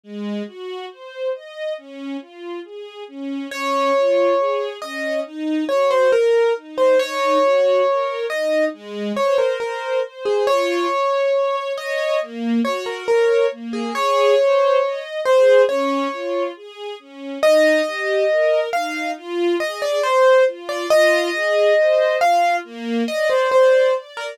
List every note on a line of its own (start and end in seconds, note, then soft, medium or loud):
0.03 0.43 G#3 medium
0.47 0.86 F#4 medium
0.90 1.30 C5 medium
1.34 1.73 D#5 medium
1.78 2.17 C#4 medium
2.21 2.60 F4 medium
2.64 3.04 G#4 medium
3.08 3.47 C#4 medium
3.51 3.91 C#4 loud
3.51 4.69 C#5 loud
3.95 4.34 F4 medium
4.38 4.77 G#4 medium
4.82 5.21 C#4 medium
4.82 5.20 D#5 medium
5.25 5.64 D#4 loud
5.69 6.08 F#4 medium
5.69 5.89 C#5 medium
5.91 6.11 C5 medium
6.12 6.51 A#4 medium
6.12 6.53 A#4 medium
6.56 6.95 D#4 medium
6.78 6.98 C5 medium
6.99 7.38 D#4 loud
6.99 8.26 C#5 loud
7.43 7.82 F#4 medium
7.87 8.26 A#4 medium
8.30 8.69 D#4 medium
8.30 8.65 D#5 medium
8.73 9.12 G#3 loud
9.16 9.56 C5 medium
9.16 9.37 C#5 medium
9.38 9.59 A#4 medium
9.60 10.02 A#4 medium
9.60 9.99 C5 medium
10.03 10.43 C5 medium
10.25 10.46 G#4 medium
10.47 10.86 F4 loud
10.47 11.56 C#5 loud
10.90 11.30 C#5 medium
11.34 11.73 C#5 medium
11.78 12.17 C#5 loud
11.78 12.20 D#5 medium
12.21 12.60 A#3 loud
12.64 13.03 F#4 medium
12.64 12.85 C#5 medium
12.86 13.07 A#4 medium
13.08 13.46 A#4 medium
13.08 13.47 C#5 medium
13.51 13.91 A#3 medium
13.73 13.94 G#4 medium
13.95 14.34 G#4 loud
13.95 15.00 C#5 loud
14.38 14.78 C5 medium
14.82 15.21 D#5 medium
15.25 15.64 G#4 medium
15.25 15.62 C5 loud
15.69 16.08 C#4 loud
15.69 16.44 C#5 medium
16.12 16.51 F4 medium
16.56 16.95 G#4 medium
16.99 17.38 C#4 medium
17.43 17.82 D#4 loud
17.43 18.60 D#5 loud
17.86 18.25 G4 medium
18.30 18.69 A#4 medium
18.73 19.12 D#4 medium
18.73 19.11 F5 loud
19.16 19.56 F4 loud
19.60 19.99 G#4 medium
19.60 19.81 D#5 loud
19.82 20.03 D5 loud
20.03 20.44 C5 loud
20.03 20.43 C5 medium
20.47 20.86 F4 medium
20.69 20.89 D5 medium
20.90 21.30 F4 loud
20.90 22.17 D#5 loud
21.34 21.73 G#4 medium
21.78 22.17 C5 medium
22.21 22.60 F4 medium
22.21 22.56 F5 loud
22.64 23.03 A#3 loud
23.08 23.47 D5 medium
23.08 23.29 D#5 loud
23.30 23.50 C5 medium
23.51 23.94 C5 medium
23.51 23.91 D5 medium
23.95 24.34 D5 medium
24.17 24.38 A#4 medium